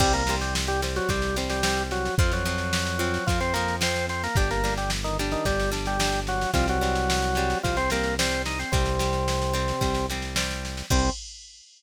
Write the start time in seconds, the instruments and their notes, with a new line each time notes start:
0.00 synth bass 1 C2, drawbar organ G3 G4, acoustic guitar (steel) G3 C4, kick, snare, crash
0.13 drawbar organ A#3 A#4, snare
0.27 acoustic guitar (steel) G3 C4, snare
0.41 drawbar organ G3 G4, snare
0.55 snare
0.67 drawbar organ G3 G4, snare
0.82 acoustic guitar (steel) G3 C4, snare
0.96 drawbar organ F#3 F#4, snare
1.09 synth bass 1 C2, acoustic guitar (steel) G3 C4, drawbar organ G3 G4, kick, snare
1.22 snare
1.36 acoustic guitar (steel) G3 C4, snare
1.50 drawbar organ G3 G4, snare
1.63 acoustic guitar (steel) G3 C4, snare
1.77 snare
1.91 drawbar organ F#3 F#4, snare
2.05 snare
2.18 synth bass 1 F2, acoustic guitar (steel) F3 C4, drawbar organ F3 F4, kick, snare
2.31 drawbar organ F#3 F#4, snare
2.45 acoustic guitar (steel) F3 C4, snare
2.58 snare
2.73 snare
2.86 snare
2.99 acoustic guitar (steel) F3 C4, snare
3.14 snare
3.27 synth bass 1 F2, drawbar organ F3 F4, acoustic guitar (steel) F3 C4, kick, snare
3.40 drawbar organ C4 C5, snare
3.54 acoustic guitar (steel) F3 C4, drawbar organ A#3 A#4, snare
3.68 snare
3.81 acoustic guitar (steel) F3 C4, drawbar organ C4 C5, snare
3.96 snare
4.09 drawbar organ C4 C5, snare
4.24 drawbar organ A#3 A#4, snare
4.35 synth bass 1 G1, acoustic guitar (steel) G3 D4, drawbar organ G3 G4, kick, snare
4.51 drawbar organ A#3 A#4, snare
4.64 acoustic guitar (steel) G3 D4, snare
4.78 drawbar organ G3 G4, snare
4.90 snare
5.04 drawbar organ D#3 D#4, snare
5.19 acoustic guitar (steel) G3 D4, snare
5.31 drawbar organ D#3 D#4, snare
5.45 synth bass 1 G1, drawbar organ G3 G4, acoustic guitar (steel) G3 D4, kick, snare
5.60 snare
5.71 acoustic guitar (steel) G3 D4, snare
5.86 drawbar organ G3 G4, snare
5.99 acoustic guitar (steel) G3 D4, snare
6.13 snare
6.27 drawbar organ F#3 F#4, snare
6.41 snare
6.54 synth bass 1 C2, drawbar organ F3 F4, acoustic guitar (steel) G3 C4, kick, snare
6.68 drawbar organ F#3 F#4, snare
6.81 acoustic guitar (steel) G3 C4, snare
6.95 snare
7.10 snare
7.23 snare
7.35 acoustic guitar (steel) G3 C4, snare
7.50 snare
7.63 synth bass 1 C2, drawbar organ F3 F4, acoustic guitar (steel) G3 C4, kick, snare
7.77 drawbar organ C4 C5, snare
7.90 acoustic guitar (steel) G3 C4, drawbar organ A#3 A#4, snare
8.03 snare
8.19 acoustic guitar (steel) G3 C4, drawbar organ C4 C5, snare
8.31 snare
8.46 drawbar organ D#4 D#5, snare
8.59 drawbar organ C4 C5, snare
8.72 synth bass 1 C2, drawbar organ C3 C4, acoustic guitar (steel) G3 C4, kick, snare
8.86 snare
8.99 acoustic guitar (steel) G3 C4, snare
9.13 snare
9.28 snare
9.42 snare
9.54 acoustic guitar (steel) G3 C4, snare
9.68 snare
9.81 synth bass 1 C2, acoustic guitar (steel) G3 C4, kick, snare
9.95 snare
10.10 acoustic guitar (steel) G3 C4, snare
10.22 snare
10.36 acoustic guitar (steel) G3 C4, snare
10.51 snare
10.65 snare
10.77 snare
10.90 synth bass 1 C2, acoustic guitar (steel) G3 C4, drawbar organ C4, kick, crash